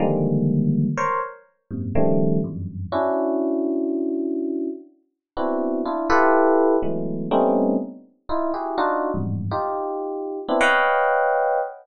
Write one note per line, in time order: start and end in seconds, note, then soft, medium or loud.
0.00 0.87 D3 medium
0.00 0.87 D#3 medium
0.00 0.87 F3 medium
0.00 0.87 G3 medium
0.00 0.87 G#3 medium
0.00 0.87 A#3 medium
0.97 1.19 A#4 loud
0.97 1.19 C5 loud
0.97 1.19 C#5 loud
1.71 1.92 F#2 medium
1.71 1.92 G#2 medium
1.71 1.92 A#2 medium
1.71 1.92 C3 medium
1.95 2.39 C#3 loud
1.95 2.39 D#3 loud
1.95 2.39 F3 loud
1.95 2.39 G3 loud
1.95 2.39 A3 loud
2.44 2.88 E2 medium
2.44 2.88 F2 medium
2.44 2.88 F#2 medium
2.44 2.88 G2 medium
2.92 4.68 C#4 medium
2.92 4.68 D4 medium
2.92 4.68 E4 medium
2.92 4.68 F#4 medium
5.37 5.81 B3 medium
5.37 5.81 C4 medium
5.37 5.81 D4 medium
5.37 5.81 E4 medium
5.37 5.81 F#4 medium
5.85 6.07 D4 medium
5.85 6.07 E4 medium
5.85 6.07 F4 medium
6.10 6.76 E4 loud
6.10 6.76 F4 loud
6.10 6.76 G4 loud
6.10 6.76 A4 loud
6.10 6.76 B4 loud
6.83 7.26 E3 medium
6.83 7.26 F#3 medium
6.83 7.26 G#3 medium
6.83 7.26 A3 medium
6.83 7.26 B3 medium
7.31 7.75 G3 loud
7.31 7.75 A3 loud
7.31 7.75 B3 loud
7.31 7.75 C4 loud
7.31 7.75 C#4 loud
7.31 7.75 D#4 loud
8.29 8.51 D#4 medium
8.29 8.51 E4 medium
8.29 8.51 F4 medium
8.54 8.76 E4 medium
8.54 8.76 F#4 medium
8.54 8.76 G4 medium
8.54 8.76 G#4 medium
8.78 9.11 D4 loud
8.78 9.11 D#4 loud
8.78 9.11 F4 loud
8.78 9.11 F#4 loud
9.14 9.47 E2 medium
9.14 9.47 F2 medium
9.14 9.47 G2 medium
9.14 9.47 G#2 medium
9.51 10.39 D#4 medium
9.51 10.39 F4 medium
9.51 10.39 G4 medium
10.48 10.59 B3 medium
10.48 10.59 C4 medium
10.48 10.59 D4 medium
10.48 10.59 E4 medium
10.61 11.59 B4 loud
10.61 11.59 C#5 loud
10.61 11.59 D#5 loud
10.61 11.59 F5 loud
10.61 11.59 F#5 loud
10.61 11.59 G5 loud